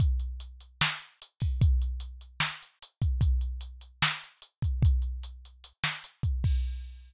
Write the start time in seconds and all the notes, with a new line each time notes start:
0.00 kick, closed hi-hat
0.20 closed hi-hat
0.40 closed hi-hat
0.61 closed hi-hat
0.81 snare
1.00 closed hi-hat
1.22 closed hi-hat
1.40 kick, open hi-hat
1.61 kick, closed hi-hat
1.82 closed hi-hat
2.00 closed hi-hat
2.21 closed hi-hat
2.40 snare
2.63 closed hi-hat
2.82 closed hi-hat
3.02 kick, closed hi-hat
3.21 kick, closed hi-hat
3.41 closed hi-hat
3.61 closed hi-hat
3.81 closed hi-hat
4.02 snare
4.23 closed hi-hat
4.42 closed hi-hat
4.62 kick, closed hi-hat
4.82 kick, closed hi-hat
5.02 closed hi-hat
5.23 closed hi-hat
5.45 closed hi-hat
5.64 closed hi-hat
5.84 snare
6.04 closed hi-hat
6.23 kick, closed hi-hat
6.44 kick, crash